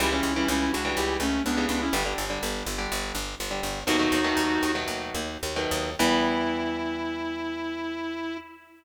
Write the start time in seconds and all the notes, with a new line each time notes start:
0.00 C#2 C#3 E3 G3 E4 G4
0.12 C#3 E3 G3 C#4 E4
0.23 C#2
0.36 C#3 E3 G3 C#4 E4
0.48 C#2 C#4 E4
0.73 C#2 D4 F#4
0.85 C#3 E3 G3
0.96 C#2 E4 G4
1.20 C#2 A3 C#4
1.45 C#2 B3 D4
1.57 C#3 E3 G3
1.69 C#2 B3 D4
1.81 C#4 E4
1.93 G1 D3 G3
2.06 D3 G3
2.18 G1
2.30 D3 G3
2.43 G1
2.66 G1
2.78 D3 G3
2.92 G1
3.15 G1
3.40 G1
3.51 D3 G3
3.63 G1
3.87 D#2 B2 D#3 F#3 A3 D#4 F#4
3.99 B2 D#3 F#3 A3
4.12 D#2
4.24 B2 D#3 F#3 A3
4.37 D#2
4.63 D#2
4.75 B2 D#3 F#3 A3
4.88 D#2
5.14 D#2
5.43 D#2
5.56 B2 D#3 F#3 A3
5.71 D#2
5.99 E2 E3 G3 B3 E4